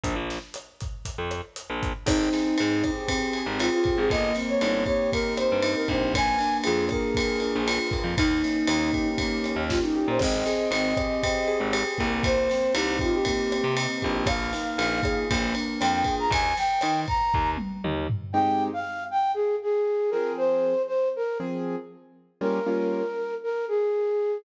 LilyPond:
<<
  \new Staff \with { instrumentName = "Flute" } { \time 4/4 \key aes \major \tempo 4 = 118 r1 | ees'2 r4 f'16 f'8 aes'16 | ees''8 r16 des''8. des''8 bes'8 c''8. bes'16 c''8 | aes''4 aes'8 bes'4. r4 |
ees'2 r4 f'16 ees'8 c''16 | ees''2. r4 | c''4 g'8 f'16 g'16 g'4 r4 | f''2 r4 g''16 g''8 bes''16 |
aes''8 g''4 bes''4 r4. | g''8. f''8. g''8 aes'8 aes'4 bes'8 | c''4 c''8 bes'8 r2 | bes'2 bes'8 aes'4. | }
  \new Staff \with { instrumentName = "Acoustic Grand Piano" } { \time 4/4 \key aes \major r1 | c'8 aes'8 c'8 g'8 c'8 aes'8 g'8 c'8 | bes8 c'8 ees'8 g'8 bes8 c'8 ees'8 g'8 | bes8 d'8 f'8 aes'8 bes8 d'8 f'8 bes8~ |
bes8 des'8 ees'8 g'8 bes8 des'8 ees'8 g'8 | c'8 aes'8 c'8 g'8 c'8 aes'8 g'8 bes8~ | bes8 c'8 ees'8 g'8 bes8 c'8 ees'8 g'8 | bes8 ees'8 f'8 aes'8 bes8 d'8 f'8 aes'8 |
r1 | <aes c' ees' g'>2.~ <aes c' ees' g'>8 <f c' aes'>8~ | <f c' aes'>2 <f c' aes'>2 | <g bes des' f'>8 <g bes des' f'>2.~ <g bes des' f'>8 | }
  \new Staff \with { instrumentName = "Electric Bass (finger)" } { \clef bass \time 4/4 \key aes \major bes,,16 bes,,2 f,4 bes,,8. | aes,,4 aes,4.~ aes,16 aes,,4 aes,,16 | g,,4 g,,4.~ g,,16 g,8. bes,,8~ | bes,,4 f,4.~ f,16 bes,,4 f,16 |
ees,4 ees,4.~ ees,16 ees,4 bes,16 | aes,,4 aes,,4.~ aes,,16 aes,,8. c,8~ | c,4 c,4.~ c,16 c8. bes,,8~ | bes,,4 bes,,4 bes,,4 f,4 |
ees,4 ees4 ees,4 ees,4 | r1 | r1 | r1 | }
  \new DrumStaff \with { instrumentName = "Drums" } \drummode { \time 4/4 <hh bd>8 <hh sn>8 <hh ss>8 <hh bd>8 <hh bd>8 <hh ss>8 hh8 <hh bd>8 | <cymc bd ss>8 <cymr sn>8 cymr8 <bd cymr ss>8 <bd cymr>8 cymr8 <cymr ss>8 <bd cymr>8 | <bd cymr>8 <cymr sn>8 <cymr ss>8 <bd cymr>8 <bd cymr>8 <cymr ss>8 cymr8 <bd cymr>8 | <bd cymr ss>8 <cymr sn>8 cymr8 <bd cymr ss>8 <bd cymr>8 cymr8 <cymr ss>8 <bd cymr>8 |
<bd cymr>8 <cymr sn>8 <cymr ss>8 <bd cymr>8 <bd cymr>8 <cymr ss>8 <bd sn>4 | <cymc bd ss>8 <cymr sn>8 cymr8 <bd cymr ss>8 <bd cymr>8 cymr8 <cymr ss>8 <bd cymr>8 | <bd cymr>8 <cymr sn>8 <cymr ss>8 <bd cymr>8 <bd cymr>8 <cymr ss>8 cymr8 <bd cymr>8 | <bd cymr ss>8 <cymr sn>8 cymr8 <bd cymr ss>8 <bd cymr>8 cymr8 <cymr ss>8 <bd cymr>8 |
<bd cymr>8 <cymr sn>8 <cymr ss>8 <bd cymr>8 bd8 tommh8 toml8 tomfh8 | r4 r4 r4 r4 | r4 r4 r4 r4 | r4 r4 r4 r4 | }
>>